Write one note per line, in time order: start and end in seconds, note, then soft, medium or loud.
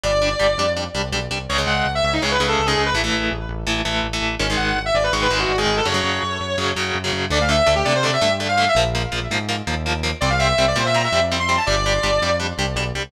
0.04 0.34 G1 medium
0.04 0.11 G3 medium
0.04 0.11 D4 medium
0.04 0.70 D5 medium
0.22 0.29 G3 medium
0.22 0.29 D4 medium
0.39 0.56 G1 medium
0.39 0.47 G3 medium
0.39 0.47 D4 medium
0.57 0.88 F2 medium
0.57 0.66 G3 medium
0.57 0.66 D4 medium
0.77 0.84 G3 medium
0.77 0.84 D4 medium
0.94 1.11 C2 medium
0.94 1.02 G3 medium
0.94 1.02 D4 medium
1.12 1.28 B1 medium
1.12 1.20 G3 medium
1.12 1.20 D4 medium
1.31 1.47 C2 medium
1.31 1.38 G3 medium
1.31 1.38 D4 medium
1.49 1.65 C#2 medium
1.49 1.57 C#3 loud
1.49 1.57 G#3 medium
1.49 1.58 C#5 medium
1.58 1.87 C#3 medium
1.58 1.87 G#3 medium
1.67 1.82 C#2 medium
1.67 1.90 F#5 medium
1.85 2.01 C#2 medium
1.95 2.04 E5 loud
2.03 2.19 C#2 medium
2.03 2.13 E5 medium
2.13 2.22 D#4 medium
2.22 2.38 C#2 medium
2.22 2.37 C#3 medium
2.22 2.37 G#3 medium
2.22 2.31 C#5 medium
2.31 2.46 B4 medium
2.40 2.55 C#2 medium
2.40 2.62 C#3 medium
2.40 2.62 G#3 medium
2.48 2.65 A4 medium
2.59 2.74 C#2 medium
2.66 2.90 C#3 medium
2.66 2.90 G#3 medium
2.66 2.81 G#4 loud
2.77 2.92 C#2 medium
2.86 2.95 B4 medium
2.94 3.09 A1 medium
2.94 3.02 E3 medium
2.94 3.02 A3 medium
3.04 3.33 E3 medium
3.04 3.33 A3 medium
3.13 3.29 A1 medium
3.31 3.47 A1 medium
3.49 3.64 A1 medium
3.67 3.82 A1 medium
3.67 3.81 E3 medium
3.67 3.81 A3 medium
3.85 4.01 A1 medium
3.85 4.07 E3 medium
3.85 4.07 A3 medium
4.03 4.19 A1 medium
4.13 4.35 E3 medium
4.13 4.35 A3 medium
4.21 4.37 A1 medium
4.39 4.56 G#1 medium
4.39 4.47 D#3 medium
4.39 4.47 G#3 medium
4.39 4.48 C#4 loud
4.50 4.79 D#3 medium
4.50 4.79 G#3 medium
4.57 4.73 G#1 medium
4.57 4.79 F#5 medium
4.75 4.90 G#1 medium
4.86 4.94 E5 medium
4.94 5.09 G#1 medium
4.94 5.03 D5 medium
5.04 5.12 B4 medium
5.12 5.28 G#1 medium
5.12 5.28 D#3 medium
5.12 5.28 G#3 medium
5.12 5.21 C#6 loud
5.22 5.37 B4 medium
5.30 5.45 G#1 medium
5.30 5.52 D#3 medium
5.30 5.52 G#3 medium
5.40 5.56 F#4 medium
5.49 5.65 G#1 medium
5.58 5.80 D#3 medium
5.58 5.80 G#3 medium
5.58 5.75 G#4 loud
5.66 5.81 G#1 medium
5.77 5.86 A4 medium
5.85 6.01 F#2 medium
5.85 5.93 C#3 medium
5.85 5.93 F#3 medium
5.85 6.67 C#5 loud
5.94 6.23 C#3 medium
5.94 6.23 F#3 medium
6.04 6.19 F#2 medium
6.23 6.38 F#2 medium
6.40 6.56 F#2 medium
6.58 6.73 F#2 medium
6.58 6.72 C#3 medium
6.58 6.72 F#3 medium
6.76 6.91 F#2 medium
6.76 6.98 C#3 medium
6.76 6.98 F#3 medium
6.95 7.10 F#2 medium
7.04 7.26 C#3 medium
7.04 7.26 F#3 medium
7.13 7.28 F#2 medium
7.30 7.61 D2 loud
7.30 7.38 D3 loud
7.30 7.38 A3 loud
7.30 7.40 D5 loud
7.41 7.49 F5 medium
7.49 7.56 D3 medium
7.49 7.56 A3 medium
7.49 7.72 E5 loud
7.67 7.83 D2 medium
7.67 7.74 D3 medium
7.67 7.74 A3 medium
7.76 7.84 G4 loud
7.85 8.17 C3 medium
7.85 7.93 D3 medium
7.85 7.93 A3 medium
7.85 7.93 D5 loud
7.95 8.04 C5 loud
8.03 8.10 D3 medium
8.03 8.10 A3 medium
8.03 8.13 D5 loud
8.13 8.30 E5 loud
8.21 8.68 G2 medium
8.21 8.29 D3 medium
8.21 8.29 A3 medium
8.40 8.47 D3 medium
8.40 8.47 A3 medium
8.49 8.65 F5 loud
8.58 8.65 D3 medium
8.58 8.65 A3 medium
8.68 8.77 E5 loud
8.75 9.06 A#1 loud
8.75 8.84 F3 loud
8.75 8.84 A#3 medium
8.95 9.02 F3 medium
8.95 9.02 A#3 medium
9.12 9.27 A#1 medium
9.12 9.19 F3 medium
9.12 9.19 A#3 medium
9.31 9.62 G#2 medium
9.31 9.38 F3 medium
9.31 9.38 A#3 medium
9.49 9.56 F3 medium
9.49 9.56 A#3 medium
9.67 10.13 D#2 medium
9.67 9.74 F3 medium
9.67 9.74 A#3 medium
9.86 9.93 F3 medium
9.86 9.93 A#3 medium
10.03 10.11 F3 medium
10.03 10.11 A#3 medium
10.21 10.53 C2 loud
10.21 10.29 G3 medium
10.21 10.29 C4 loud
10.21 10.29 D5 loud
10.30 10.39 F5 loud
10.39 10.47 G3 medium
10.39 10.47 C4 medium
10.39 10.62 E5 loud
10.58 10.74 C2 medium
10.58 10.65 G3 medium
10.58 10.65 C4 medium
10.68 10.77 D5 loud
10.76 11.07 A#2 medium
10.76 10.83 G3 medium
10.76 10.83 C4 medium
10.76 10.86 C5 loud
10.86 10.95 E5 loud
10.94 11.02 G3 medium
10.94 11.02 C4 medium
10.94 11.04 A#5 loud
11.04 11.19 E5 loud
11.12 11.58 F2 medium
11.12 11.20 G3 medium
11.12 11.20 C4 medium
11.32 11.39 G3 medium
11.32 11.39 C4 medium
11.40 11.55 C6 loud
11.49 11.56 G3 medium
11.49 11.56 C4 medium
11.57 11.66 A5 loud
11.67 11.98 G1 loud
11.67 11.75 G3 loud
11.67 11.75 D4 medium
11.67 12.32 D5 loud
11.86 11.93 G3 medium
11.86 11.93 D4 medium
12.03 12.19 G1 medium
12.03 12.11 G3 medium
12.03 12.11 D4 medium
12.22 12.53 F2 medium
12.22 12.30 G3 medium
12.22 12.30 D4 medium
12.40 12.47 G3 medium
12.40 12.47 D4 medium
12.58 12.75 C2 medium
12.58 12.66 G3 medium
12.58 12.66 D4 medium
12.76 12.92 B1 loud
12.76 12.84 G3 medium
12.76 12.84 D4 medium
12.95 13.11 C2 medium
12.95 13.02 G3 medium
12.95 13.02 D4 medium